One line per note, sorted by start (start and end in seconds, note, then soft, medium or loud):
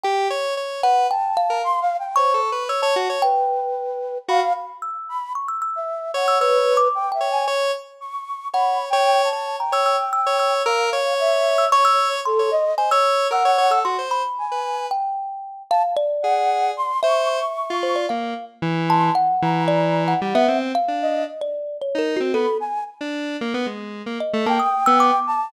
0.04 0.28 G4 loud
0.04 0.27 G5 medium
0.30 0.54 C#5 medium
0.57 0.81 C#5 medium
0.83 1.07 B4 medium
0.83 1.07 F#5 loud
1.11 1.35 G5 medium
1.11 1.58 A5 medium
1.37 2.09 F5 loud
1.50 1.62 A#4 medium
1.64 1.80 C6 loud
1.81 1.97 F5 loud
1.99 2.15 G5 medium
2.16 2.41 C5 medium
2.16 2.33 C#5 medium
2.16 2.63 C#6 loud
2.34 2.50 A4 medium
2.52 2.68 B4 medium
2.69 2.81 C#5 medium
2.69 2.81 E6 medium
2.82 2.95 C#5 loud
2.82 3.18 A5 medium
2.96 3.08 F#4 loud
3.10 3.22 C#5 medium
3.22 4.18 B4 medium
3.22 4.18 G5 loud
4.29 4.40 F#4 loud
4.29 4.53 F5 loud
4.29 4.77 B5 medium
4.82 5.18 E6 soft
5.09 5.33 B5 medium
5.35 5.47 C#6 medium
5.48 5.60 E6 medium
5.62 6.22 E6 medium
5.76 6.11 E5 medium
6.14 6.38 C#5 loud
6.14 6.38 F#5 medium
6.28 6.40 E6 medium
6.40 6.88 B4 loud
6.40 6.77 C#5 medium
6.40 6.73 E6 medium
6.77 7.09 D6 medium
6.95 7.11 G5 medium
7.12 7.29 E5 medium
7.12 7.44 G5 medium
7.21 7.45 C#5 medium
7.31 7.47 G#5 medium
7.48 7.71 C#5 loud
8.01 8.48 C#6 medium
8.53 8.89 C#5 medium
8.53 8.78 F#5 medium
8.53 8.85 B5 medium
8.90 9.29 C#5 loud
8.90 9.22 G5 loud
9.24 9.56 A5 medium
9.33 9.57 C#5 medium
9.59 10.54 G5 medium
9.59 9.72 A#5 medium
9.72 9.96 C#5 loud
9.72 9.85 E6 medium
9.86 10.10 E6 medium
10.13 10.37 E6 medium
10.27 10.62 C#5 loud
10.39 10.63 E6 medium
10.66 10.90 A#4 loud
10.66 11.14 F5 medium
10.66 10.90 E6 medium
10.93 11.64 C#5 loud
11.19 11.67 E5 medium
11.58 11.70 E6 medium
11.72 12.20 C#5 medium
11.72 12.20 C#5 loud
11.72 11.84 C#6 loud
11.85 12.09 E6 loud
12.25 12.50 A4 loud
12.25 12.73 C6 medium
12.39 12.51 C#5 medium
12.51 12.75 D#5 loud
12.78 12.90 C5 medium
12.78 12.90 G#5 medium
12.91 13.28 C#5 loud
12.91 13.27 E6 loud
13.31 13.43 A#4 medium
13.31 13.79 F#5 loud
13.31 13.68 E6 medium
13.45 13.57 C#5 medium
13.58 13.70 C#5 loud
13.71 13.83 A4 medium
13.71 13.83 E6 medium
13.85 13.97 F#4 medium
13.85 14.09 C6 medium
13.99 14.22 C5 medium
14.11 14.83 B5 medium
14.38 14.86 G#5 medium
14.52 14.87 B4 medium
14.91 15.63 G5 medium
15.70 15.95 F5 loud
15.70 15.82 A5 loud
15.97 16.92 D5 loud
16.22 16.72 G#4 medium
16.22 16.70 F#5 medium
16.77 17.01 C6 loud
17.03 17.39 C5 medium
17.03 17.74 E5 loud
17.03 17.28 C#6 medium
17.30 18.01 C#6 medium
17.70 18.06 F4 medium
17.83 17.95 C5 medium
17.96 18.08 D5 medium
18.09 18.34 A#3 medium
18.09 18.45 F5 medium
18.62 19.10 E3 loud
18.88 19.14 A5 loud
18.88 19.12 C6 medium
19.15 19.63 F#5 loud
19.42 20.14 E3 loud
19.42 20.13 A#5 medium
19.68 20.04 D5 loud
20.08 20.20 F#5 medium
20.21 20.34 G3 loud
20.21 20.57 F#5 medium
20.35 20.47 B3 loud
20.35 20.59 E5 loud
20.48 20.72 C4 medium
20.75 21.23 F5 loud
20.88 21.24 D4 medium
21.02 21.26 D#5 medium
21.41 21.77 D5 medium
21.82 21.97 C#5 medium
21.95 22.19 D#4 medium
21.95 22.14 A#4 medium
22.17 22.32 C4 medium
22.17 22.33 F#4 loud
22.33 22.46 B3 medium
22.33 22.58 A4 loud
22.33 22.57 B5 medium
22.60 22.84 G#5 medium
23.01 23.37 D4 medium
23.41 23.53 A#3 medium
23.54 23.66 B3 loud
23.66 24.02 G#3 medium
24.06 24.18 A#3 medium
24.20 24.44 D#5 medium
24.34 24.45 A3 loud
24.46 24.58 A#3 loud
24.46 25.20 G5 loud
24.46 24.58 A5 medium
24.60 24.83 D#6 medium
24.86 25.11 B3 loud
24.86 24.98 E6 loud
25.00 25.48 D6 loud
25.27 25.51 A5 loud